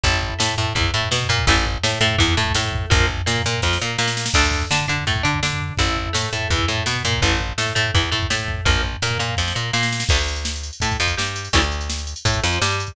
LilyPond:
<<
  \new Staff \with { instrumentName = "Acoustic Guitar (steel)" } { \time 4/4 \key d \minor \tempo 4 = 167 <e' a'>4 a8 a8 e8 a8 b8 bes8 | <e a>8 r8 a8 a8 e8 a8 a4 | <f bes>8 r8 bes8 bes8 f8 bes8 bes4 | <d' a'>4 d'8 d'8 a8 d'8 d'4 |
<e' a'>4 a8 a8 e8 a8 b8 bes8 | <e a>8 r8 a8 a8 e8 a8 a4 | <f bes>8 r8 bes8 bes8 f8 bes8 bes4 | <d a>8 r4. a8 f8 g4 |
<cis e g a>8 r4. a8 f8 g4 | }
  \new Staff \with { instrumentName = "Electric Bass (finger)" } { \clef bass \time 4/4 \key d \minor a,,4 a,8 a,8 e,8 a,8 b,8 bes,8 | a,,4 a,8 a,8 e,8 a,8 a,4 | bes,,4 bes,8 bes,8 f,8 bes,8 bes,4 | d,4 d8 d8 a,8 d8 d4 |
a,,4 a,8 a,8 e,8 a,8 b,8 bes,8 | a,,4 a,8 a,8 e,8 a,8 a,4 | bes,,4 bes,8 bes,8 f,8 bes,8 bes,4 | d,2 a,8 f,8 g,4 |
d,2 a,8 f,8 g,4 | }
  \new DrumStaff \with { instrumentName = "Drums" } \drummode { \time 4/4 <bd tomfh>16 tomfh16 tomfh16 tomfh16 sn16 tomfh16 tomfh16 tomfh16 <bd tomfh>16 <bd tomfh>16 tomfh16 tomfh16 sn16 tomfh16 tomfh16 <bd tomfh>16 | <bd tomfh>16 tomfh16 tomfh16 tomfh16 sn16 tomfh16 tomfh16 tomfh16 <bd tomfh>16 tomfh16 tomfh16 <bd tomfh>16 sn16 tomfh16 <bd tomfh>16 tomfh16 | <bd tomfh>16 tomfh16 tomfh16 tomfh16 sn16 tomfh16 tomfh16 tomfh16 <bd sn>16 sn8. sn16 sn16 sn16 sn16 | <cymc bd>16 tomfh16 tomfh16 tomfh16 sn16 tomfh16 tomfh16 tomfh16 <bd tomfh>16 <bd tomfh>16 tomfh16 <bd tomfh>16 sn16 tomfh16 tomfh16 tomfh16 |
<bd tomfh>16 tomfh16 tomfh16 tomfh16 sn16 tomfh16 tomfh16 tomfh16 <bd tomfh>16 <bd tomfh>16 tomfh16 tomfh16 sn16 tomfh16 tomfh16 <bd tomfh>16 | <bd tomfh>16 tomfh16 tomfh16 tomfh16 sn16 tomfh16 tomfh16 tomfh16 <bd tomfh>16 tomfh16 tomfh16 <bd tomfh>16 sn16 tomfh16 <bd tomfh>16 tomfh16 | <bd tomfh>16 tomfh16 tomfh16 tomfh16 sn16 tomfh16 tomfh16 tomfh16 <bd sn>16 sn8. sn16 sn16 sn16 sn16 | <cymc bd>16 hh16 hh16 hh16 sn16 hh16 hh16 hh16 <hh bd>16 <hh bd>16 hh16 <hh bd>16 sn16 hh16 hh16 hh16 |
<hh bd>16 hh16 hh16 hh16 sn16 hh16 hh16 hh16 <hh bd>16 <hh bd>16 hh16 hh16 sn16 hh16 hh16 <hh bd>16 | }
>>